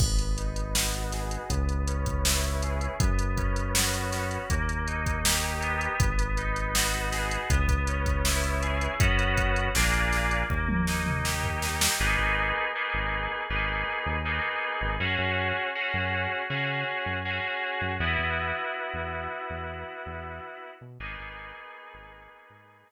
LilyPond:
<<
  \new Staff \with { instrumentName = "Electric Piano 2" } { \time 4/4 \key gis \minor \tempo 4 = 80 b8 dis'8 fis'8 gis'8 b8 cis'8 e'8 gis'8 | b8 cis'8 fis'8 cis'8 ais8 dis'8 g'8 b8~ | b8 dis'8 fis'8 gis'8 b8 cis'8 e'8 gis'8 | <b cis' fis'>4 <ais d' eis' gis'>4 ais8 dis'8 g'8 dis'8 |
<ais b dis' gis'>4 <ais b dis' gis'>4 <ais b dis' gis'>4 <ais b dis' gis'>4 | <cis' fis' gis'>4 <cis' fis' gis'>4 <cis' fis' gis'>4 <cis' fis' gis'>4 | <b e' fis'>1 | <ais b dis' gis'>1 | }
  \new Staff \with { instrumentName = "Synth Bass 1" } { \clef bass \time 4/4 \key gis \minor gis,,2 cis,2 | fis,2 dis,2 | gis,,2 cis,2 | fis,4 ais,,4 dis,2 |
gis,,16 gis,,4 gis,,8. gis,,8. dis,4 gis,,16 | fis,16 fis,4 fis,8. cis8. fis,4 fis,16 | e,16 e,4 e,8. e,8. e,4 b,16 | gis,,16 gis,,4 gis,,8. gis,8. r4 r16 | }
  \new DrumStaff \with { instrumentName = "Drums" } \drummode { \time 4/4 <cymc bd>16 hh16 hh16 hh16 sn16 hh16 <hh sn>16 hh16 <hh bd>16 hh16 hh16 <hh bd>16 sn16 hh16 hh16 hh16 | <hh bd>16 hh16 <hh bd>16 hh16 sn16 hh16 <hh sn>16 hh16 <hh bd>16 hh16 hh16 <hh bd>16 sn16 hh16 hh16 hh16 | <hh bd>16 hh16 hh16 hh16 sn16 hh16 <hh sn>16 hh16 <hh bd>16 <hh bd>16 hh16 <hh bd>16 sn16 hh16 hh16 hh16 | <hh bd>16 hh16 <hh bd>16 hh16 sn16 hh16 <hh sn>16 hh16 bd16 tommh16 sn16 toml16 sn16 tomfh16 sn16 sn16 |
r4 r4 r4 r4 | r4 r4 r4 r4 | r4 r4 r4 r4 | r4 r4 r4 r4 | }
>>